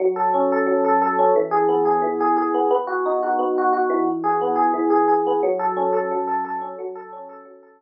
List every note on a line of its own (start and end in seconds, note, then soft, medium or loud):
0.00 0.66 F#3 loud
0.16 0.52 A4 medium
0.34 1.18 C#4 medium
0.52 0.84 A4 medium
0.67 1.31 F#3 loud
0.85 1.01 A4 medium
1.02 1.34 A4 loud
1.19 1.35 C#4 loud
1.36 2.01 E3 loud
1.51 1.85 G#4 loud
1.69 2.54 B3 medium
1.85 2.20 G#4 medium
2.02 2.66 E3 loud
2.20 2.36 G#4 loud
2.37 2.69 G#4 medium
2.54 2.70 B3 medium
2.71 3.39 B3 loud
2.87 3.22 F#4 medium
3.06 4.02 D#4 medium
3.23 3.57 F#4 medium
3.39 4.03 B3 medium
3.58 3.72 F#4 medium
3.73 4.05 F#4 loud
3.90 4.73 E3 loud
4.24 4.55 G#4 medium
4.41 5.26 B3 medium
4.56 4.90 G#4 loud
4.74 5.38 E3 loud
4.90 5.08 G#4 medium
5.08 5.40 G#4 medium
5.27 5.43 B3 medium
5.43 6.11 F#3 loud
5.59 5.92 A4 medium
5.77 6.61 C#4 loud
5.93 6.27 A4 medium
6.11 6.76 F#3 loud
6.27 6.44 A4 medium
6.45 6.77 A4 medium
6.62 6.78 C#4 medium
6.79 7.45 F#3 loud
6.95 7.29 A4 loud
7.13 7.82 C#4 medium
7.29 7.62 A4 loud
7.45 7.82 F#3 medium
7.63 7.80 A4 medium
7.81 7.82 A4 medium